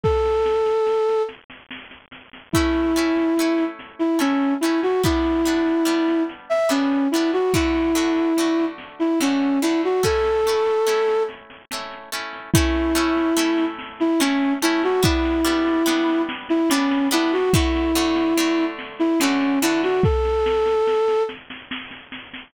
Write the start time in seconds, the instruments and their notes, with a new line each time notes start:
0.03 flute A4, kick, snare
0.25 snare
0.45 snare
0.66 snare
0.86 snare
1.09 snare
1.28 snare
1.50 snare
1.70 snare
1.91 snare
2.12 snare
2.33 snare
2.53 acoustic guitar (steel) A3 C#4, flute E4, kick, snare
2.57 acoustic guitar (steel) E4
2.74 snare
2.96 acoustic guitar (steel) A3 C#4 E4, snare
3.16 snare
3.37 acoustic guitar (steel) A3 C#4, snare
3.41 acoustic guitar (steel) E4
3.58 snare
3.79 snare
3.99 flute E4, snare
4.19 acoustic guitar (steel) A3 C#4 E4, flute C#4, snare
4.41 snare
4.61 acoustic guitar (steel) A3 C#4, flute E4, snare
4.65 acoustic guitar (steel) E4
4.83 flute F#4, snare
5.03 acoustic guitar (steel) G3 B3 D4, flute E4, kick, snare
5.25 snare
5.45 acoustic guitar (steel) G3 B3 D4, snare
5.66 snare
5.85 acoustic guitar (steel) G3 B3 D4, snare
6.08 snare
6.29 snare
6.49 flute E5, snare
6.69 acoustic guitar (steel) G3 B3 D4, flute C#4, snare
6.92 snare
7.11 acoustic guitar (steel) G3 B3, flute E4, snare
7.16 acoustic guitar (steel) D4
7.33 flute F#4, snare
7.54 acoustic guitar (steel) D3 A3 F#4, flute E4, kick, snare
7.75 snare
7.95 acoustic guitar (steel) D3 A3 F#4, snare
8.16 snare
8.37 acoustic guitar (steel) D3 A3 F#4, snare
8.59 snare
8.78 snare
8.99 flute E4, snare
9.20 acoustic guitar (steel) D3 A3 F#4, flute C#4, snare
9.41 snare
9.62 acoustic guitar (steel) D3 A3 F#4, flute E4, snare
9.83 flute F#4, snare
10.03 acoustic guitar (steel) A3 C#4 E4, flute A4, kick, snare
10.24 snare
10.45 acoustic guitar (steel) A3 C#4 E4, snare
10.66 snare
10.87 acoustic guitar (steel) A3 C#4 E4, snare
11.08 snare
11.29 snare
11.50 snare
11.71 acoustic guitar (steel) A3 C#4 E4, snare
11.91 snare
12.12 acoustic guitar (steel) A3 C#4 E4, snare
12.33 snare
12.53 acoustic guitar (steel) A3 C#4 E4, flute E4, kick, snare
12.75 snare
12.95 acoustic guitar (steel) A3 C#4 E4, snare
13.17 snare
13.37 acoustic guitar (steel) A3 C#4 E4, snare
13.58 snare
13.79 snare
14.00 flute E4, snare
14.20 acoustic guitar (steel) A3 C#4 E4, flute C#4, snare
14.41 snare
14.62 acoustic guitar (steel) A3 C#4 E4, flute E4, snare
14.83 flute F#4, snare
15.03 acoustic guitar (steel) G3 B3 D4, flute E4, kick, snare
15.25 snare
15.45 acoustic guitar (steel) G3 B3 D4, snare
15.67 snare
15.86 acoustic guitar (steel) G3 B3 D4, snare
16.09 snare
16.29 snare
16.49 flute E4, snare
16.69 acoustic guitar (steel) G3 B3, flute C#4, snare
16.73 acoustic guitar (steel) D4
16.91 snare
17.11 acoustic guitar (steel) G3 B3 D4, flute E4, snare
17.32 flute F#4, snare
17.53 acoustic guitar (steel) D3 A3 F#4, flute E4, kick, snare
17.75 snare
17.95 acoustic guitar (steel) D3 A3 F#4, snare
18.16 snare
18.37 acoustic guitar (steel) D3 A3 F#4, snare
18.59 snare
18.79 snare
18.99 flute E4, snare
19.20 acoustic guitar (steel) D3 A3 F#4, flute C#4, snare
19.41 snare
19.62 acoustic guitar (steel) D3 A3 F#4, flute E4, snare
19.83 flute F#4, snare
20.03 flute A4, kick, snare
20.25 snare
20.46 snare
20.66 snare
20.87 snare
21.08 snare
21.29 snare
21.50 snare
21.71 snare
21.91 snare
22.12 snare
22.34 snare